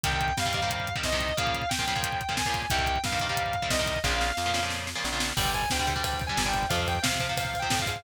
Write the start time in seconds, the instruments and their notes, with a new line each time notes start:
0.03 electric bass (finger) C2, overdriven guitar C3 D#3 G3, distortion guitar G5, kick, closed hi-hat
0.12 kick
0.21 kick, closed hi-hat
0.28 kick
0.37 electric bass (finger) G2, distortion guitar F5, kick, snare
0.46 overdriven guitar C3 D#3 G3, kick
0.53 overdriven guitar C3 D#3 G3, kick, closed hi-hat
0.62 overdriven guitar C3 D#3 G3, kick
0.70 kick, closed hi-hat
0.80 kick
0.87 kick, closed hi-hat
0.96 overdriven guitar C3 D#3 G3, kick
1.03 electric bass (finger) C2, distortion guitar D#5, kick, snare
1.12 overdriven guitar C3 D#3 G3, kick
1.20 kick, closed hi-hat
1.29 kick
1.37 overdriven guitar A#2 C#3 F3, distortion guitar F5, kick, closed hi-hat
1.47 kick
1.54 kick, closed hi-hat
1.62 kick
1.69 distortion guitar G5, kick, snare
1.79 overdriven guitar A#2 C#3 F3, kick
1.87 overdriven guitar A#2 C#3 F3, kick, closed hi-hat
1.95 overdriven guitar A#2 C#3 F3, kick
2.03 kick, closed hi-hat
2.12 kick
2.21 kick, closed hi-hat
2.29 overdriven guitar A#2 C#3 F3, kick
2.37 distortion guitar G#5, kick, snare
2.45 overdriven guitar A#2 C#3 F3, kick
2.54 kick, closed hi-hat
2.62 kick
2.70 electric bass (finger) C2, overdriven guitar C3 D#3 G3, distortion guitar G5, kick, closed hi-hat
2.79 kick
2.86 kick, closed hi-hat
2.96 kick
3.04 electric bass (finger) G2, distortion guitar F5, kick, snare
3.12 overdriven guitar C3 D#3 G3, kick
3.20 overdriven guitar C3 D#3 G3, kick, closed hi-hat
3.29 overdriven guitar C3 D#3 G3, kick
3.37 kick, closed hi-hat
3.46 kick
3.53 kick, closed hi-hat
3.62 overdriven guitar C3 D#3 G3, kick
3.70 electric bass (finger) C2, distortion guitar D#5, kick, snare
3.79 overdriven guitar C3 D#3 G3, kick
3.86 kick, closed hi-hat
3.96 kick
4.04 electric bass (finger) A#1, overdriven guitar A#2 C#3 F3, distortion guitar F5, kick, snare
4.21 snare
4.37 electric bass (finger) F2, snare
4.46 overdriven guitar A#2 C#3 F3
4.54 overdriven guitar A#2 C#3 F3, snare
4.63 overdriven guitar A#2 C#3 F3
4.70 snare
4.87 snare
4.95 overdriven guitar A#2 C#3 F3
5.04 electric bass (finger) A#1, snare
5.12 overdriven guitar A#2 C#3 F3
5.20 snare
5.37 electric bass (finger) G1, overdriven guitar D3 G3, distortion guitar G5, kick, crash
5.45 kick
5.53 distortion guitar G#5, kick, ride
5.62 kick
5.70 electric bass (finger) D2, distortion guitar G5, kick, snare
5.79 overdriven guitar D3 G3, kick
5.87 overdriven guitar D3 G3, kick, ride
5.96 overdriven guitar D3 G3, kick
6.04 distortion guitar G5, kick, ride
6.13 kick
6.20 kick, ride
6.27 overdriven guitar D3 G3, distortion guitar G#5, kick
6.37 electric bass (finger) G1, kick, snare
6.45 overdriven guitar D3 G3, distortion guitar G5, kick
6.54 kick, ride
6.63 kick
6.69 electric bass (finger) F2, overdriven guitar C3 F3, distortion guitar F5, kick, ride
6.79 kick
6.87 distortion guitar G5, kick, ride
6.95 kick
7.02 electric bass (finger) C3, distortion guitar F5, kick, snare
7.12 overdriven guitar C3 F3, kick
7.20 overdriven guitar C3 F3, kick, ride
7.29 overdriven guitar C3 F3, kick
7.37 distortion guitar F5, kick, ride
7.45 kick
7.54 kick, ride
7.59 overdriven guitar C3 F3, distortion guitar G5, kick
7.70 electric bass (finger) A2, kick, snare
7.79 overdriven guitar C3 F3, distortion guitar F5, kick
7.86 electric bass (finger) G#2, kick, ride
7.96 kick